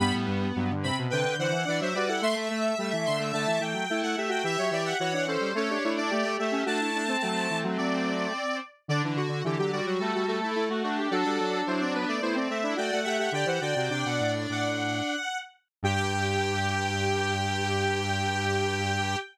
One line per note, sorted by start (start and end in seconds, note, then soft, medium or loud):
0.00 0.12 G2 medium
0.00 0.48 G3 medium
0.00 0.72 B3 loud
0.00 0.13 B5 loud
0.14 0.27 A2 medium
0.27 0.52 G2 medium
0.56 0.91 G2 medium
0.56 0.70 F#3 medium
0.71 0.84 D3 medium
0.83 1.07 C3 medium
0.83 0.96 C4 medium
0.83 0.97 B5 loud
0.99 1.12 B2 medium
1.10 1.25 C3 medium
1.10 1.35 D3 medium
1.10 1.35 B4 loud
1.10 1.37 G5 loud
1.24 1.37 D3 medium
1.38 1.52 D3 medium
1.38 1.64 E3 medium
1.38 1.62 C5 medium
1.38 1.77 F#5 loud
1.51 1.65 E3 medium
1.65 1.81 E3 medium
1.65 1.88 D4 medium
1.65 1.80 D5 loud
1.80 1.94 F#3 medium
1.80 1.95 C5 loud
1.80 1.94 E5 medium
1.94 2.21 G3 medium
1.94 2.09 F#4 medium
1.94 2.09 B4 medium
1.94 2.08 D5 loud
2.08 2.21 E4 medium
2.08 2.22 A4 medium
2.08 2.22 F#5 loud
2.21 2.72 A3 medium
2.21 2.35 A3 medium
2.21 3.63 E5 loud
2.21 2.35 C6 loud
2.36 2.49 A3 medium
2.50 2.75 A3 medium
2.78 2.91 G3 medium
2.78 3.19 A3 medium
2.93 3.06 E3 medium
3.06 3.32 D3 medium
3.06 3.19 C6 medium
3.19 3.32 A3 medium
3.33 3.46 D3 medium
3.33 3.60 A3 medium
3.33 3.60 A5 medium
3.47 3.60 E3 medium
3.60 3.73 E3 medium
3.60 3.84 A3 medium
3.60 4.00 G5 medium
3.74 3.87 F#3 medium
3.90 4.02 A3 medium
3.90 4.16 E4 medium
4.03 4.16 A3 medium
4.03 4.16 F#5 medium
4.17 4.44 A3 medium
4.17 4.31 G4 medium
4.17 4.30 E5 medium
4.29 4.42 F#4 medium
4.29 4.44 G5 medium
4.44 4.57 E3 medium
4.44 4.96 G4 medium
4.44 4.58 E5 loud
4.44 4.70 E5 loud
4.58 4.72 F#3 medium
4.58 4.71 C#5 medium
4.71 4.94 E3 medium
4.71 4.85 D5 medium
4.71 4.84 E5 medium
4.84 4.97 E5 medium
4.84 4.99 F#5 medium
4.99 5.37 E3 medium
4.99 5.12 F#4 medium
4.99 5.24 C#5 loud
4.99 5.13 F#5 medium
5.13 5.26 D4 medium
5.13 5.27 F#5 medium
5.27 5.49 C#4 medium
5.27 5.52 A4 medium
5.27 5.55 C5 medium
5.40 5.53 G3 medium
5.55 5.78 A3 medium
5.55 5.70 C#4 medium
5.55 5.70 A4 loud
5.55 5.93 C#5 loud
5.70 5.84 D4 medium
5.70 5.83 G4 medium
5.84 6.11 A3 medium
5.84 5.98 D4 medium
5.84 5.97 E4 medium
5.97 6.10 D4 loud
5.97 6.11 E4 medium
5.97 6.35 D5 loud
6.11 6.34 A3 medium
6.11 6.24 A3 medium
6.11 6.37 G4 medium
6.24 6.38 A3 medium
6.38 6.64 A3 medium
6.38 6.54 A3 medium
6.38 6.51 G4 medium
6.38 6.62 E5 medium
6.52 6.65 C#4 loud
6.52 6.65 G4 medium
6.65 7.16 A3 medium
6.65 6.90 D4 loud
6.65 6.79 F#4 medium
6.65 7.58 A5 loud
6.80 7.03 E4 medium
6.95 7.08 D4 medium
7.08 8.60 C4 medium
7.08 7.22 C4 medium
7.22 7.47 F#3 medium
7.22 8.33 A3 medium
7.50 7.64 E3 medium
7.64 7.77 F#3 medium
7.78 8.26 F#3 medium
7.78 8.57 D5 medium
8.88 9.22 D3 medium
8.88 9.02 D3 medium
8.88 9.03 D4 medium
8.88 9.02 D5 loud
9.04 9.17 E3 medium
9.04 9.18 D4 medium
9.16 9.43 D3 medium
9.16 9.43 F#4 loud
9.29 9.42 D3 medium
9.44 9.81 D3 medium
9.44 9.57 E3 medium
9.44 9.58 G4 medium
9.59 9.72 F#3 medium
9.59 9.72 G4 loud
9.72 9.97 G3 medium
9.72 9.86 F#4 medium
9.72 9.85 D5 medium
9.86 10.00 F#3 medium
9.86 10.14 F#4 medium
9.99 10.12 G3 medium
9.99 10.24 A3 medium
9.99 10.26 A4 medium
10.14 10.40 G3 medium
10.14 10.38 F#4 medium
10.28 10.51 A3 medium
10.28 10.64 A4 medium
10.41 10.98 A3 medium
10.41 10.55 E4 medium
10.55 10.69 A3 medium
10.55 10.68 E4 medium
10.70 10.83 A3 medium
10.70 10.83 F#4 medium
10.83 11.08 A3 medium
10.83 11.10 D4 medium
10.83 10.96 F#4 medium
10.97 11.10 G4 medium
11.10 11.24 F#3 medium
11.10 12.15 D4 loud
11.10 11.61 F#4 medium
11.10 11.64 A4 loud
11.26 11.39 G3 medium
11.40 11.63 F#3 medium
11.67 12.05 F#3 medium
11.67 11.81 E4 medium
11.67 11.80 C5 medium
11.81 11.94 C4 medium
11.81 11.94 D5 medium
11.94 12.19 B3 medium
11.94 12.07 B4 loud
12.08 12.21 A3 medium
12.08 12.22 D5 medium
12.22 12.48 A3 medium
12.22 12.36 B3 medium
12.22 12.35 E4 medium
12.22 12.35 C5 medium
12.34 12.59 C4 medium
12.34 12.48 C4 medium
12.34 12.49 D5 medium
12.49 12.75 A3 medium
12.49 12.62 C4 medium
12.49 12.73 E5 medium
12.63 12.77 D4 medium
12.63 12.77 E4 medium
12.76 12.91 A3 medium
12.76 13.00 F#4 medium
12.76 13.00 D5 medium
12.76 12.91 G5 medium
12.92 13.06 A3 medium
12.92 13.05 F#5 medium
13.04 13.30 A3 medium
13.04 13.18 G4 medium
13.04 13.17 E5 medium
13.04 13.30 F#5 medium
13.19 13.32 G4 medium
13.19 13.33 E5 medium
13.32 13.45 D3 medium
13.32 13.47 G4 medium
13.32 13.48 D5 medium
13.32 13.47 G5 loud
13.46 13.60 E3 medium
13.46 13.61 G4 medium
13.46 13.60 C5 medium
13.46 13.61 F#5 medium
13.60 13.75 D3 medium
13.60 13.74 F#4 medium
13.60 14.70 D5 medium
13.60 13.88 G5 medium
13.76 13.90 C3 medium
13.76 13.91 F#4 medium
13.90 14.04 C3 medium
13.90 15.16 D4 medium
13.90 14.04 G5 medium
14.05 14.20 B2 medium
14.05 14.32 F#5 medium
14.20 14.47 A2 medium
14.49 15.02 A2 medium
14.49 15.37 F#5 medium
15.83 19.16 G2 loud
15.83 19.17 G4 loud
15.83 19.18 G4 loud
15.83 19.17 G5 loud